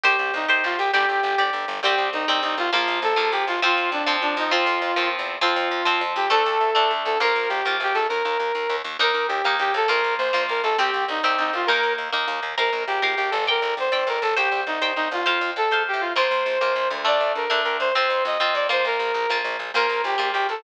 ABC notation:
X:1
M:6/8
L:1/16
Q:3/8=134
K:Bb
V:1 name="Brass Section"
G4 E4 F2 G2 | G8 z4 | G4 E4 E2 F2 | F4 A4 G2 F2 |
F4 D4 D2 E2 | F8 z4 | F10 G2 | A10 A2 |
B4 G4 G2 A2 | B10 z2 | B4 G4 G2 A2 | B4 c4 B2 A2 |
G4 E4 E2 F2 | B4 z8 | B4 G4 G2 A2 | B4 c4 B2 A2 |
G4 E4 E2 F2 | F4 A4 G2 F2 | c10 z2 | d4 B4 B2 c2 |
c4 e4 d2 c2 | B8 z4 | B4 G4 G2 A2 |]
V:2 name="Overdriven Guitar"
[Gc]6 [Gc]6 | [Gd]6 [Gd]6 | [G,C]6 [G,C]6 | [F,B,]6 [F,B,]6 |
[F,C]6 [F,C]6 | [F,C]6 [F,C]6 | [F,C]6 [F,C]6 | [A,D]6 [A,D]6 |
[B,F]6 [B,F]6 | z12 | [B,E]6 [B,E]6 | [B,F]6 [B,F]6 |
[CG]6 [CG]6 | [B,E]6 [B,E]6 | [Bf]6 [Bf]6 | [dg]6 [dg]6 |
[cg]6 [cg]6 | [cf]6 [cf]6 | [B,F]6 [B,F]6 | [A,D]6 [A,D]6 |
[CF]6 [CF]4 [B,F]2- | [B,F]6 [B,F]6 | [B,F]6 [B,F]6 |]
V:3 name="Electric Bass (finger)" clef=bass
C,,2 C,,2 C,,2 C,,2 C,,2 C,,2 | G,,,2 G,,,2 G,,,2 G,,,2 G,,,2 G,,,2 | C,,2 C,,2 C,,2 C,,2 C,,2 C,,2 | B,,,2 B,,,2 B,,,2 B,,,2 B,,,2 B,,,2 |
F,,2 F,,2 F,,2 F,,2 F,,2 F,,2- | F,,2 F,,2 F,,2 E,,3 =E,,3 | F,,2 F,,2 F,,2 F,,2 F,,2 F,,2 | D,,2 D,,2 D,,2 D,,2 D,,2 D,,2 |
B,,,2 B,,,2 B,,,2 B,,,2 B,,,2 B,,,2 | E,,2 E,,2 E,,2 E,,2 E,,2 E,,2 | E,,2 E,,2 E,,2 E,,2 E,,2 E,,2 | B,,,2 B,,,2 B,,,2 B,,,2 B,,,2 B,,,2 |
C,,2 C,,2 C,,2 C,,2 C,,2 C,,2 | E,,2 E,,2 E,,2 E,,2 E,,2 E,,2 | B,,,2 B,,,2 B,,,2 B,,,2 B,,,2 G,,,2- | G,,,2 G,,,2 G,,,2 G,,,2 G,,,2 G,,,2 |
C,,2 C,,2 C,,2 C,,2 C,,2 C,,2 | F,,2 F,,2 F,,2 _A,,3 =A,,3 | B,,,2 B,,,2 B,,,2 B,,,2 B,,,2 D,,2- | D,,2 D,,2 D,,2 D,,2 D,,2 D,,2 |
F,,2 F,,2 F,,2 F,,2 F,,2 F,,2 | B,,,2 B,,,2 B,,,2 B,,,2 B,,,2 B,,,2 | B,,,2 B,,,2 B,,,2 B,,,2 B,,,2 B,,,2 |]